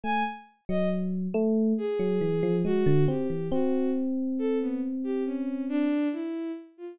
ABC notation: X:1
M:4/4
L:1/16
Q:1/4=69
K:none
V:1 name="Electric Piano 1"
A, z2 ^F,3 A,2 z F, E, =F, ^G, D, C E, | C12 z4 |]
V:2 name="Violin"
^g z2 ^d z4 ^G4 ^F2 =G2 | ^F2 z2 A B, z G ^C2 D2 E2 z =F |]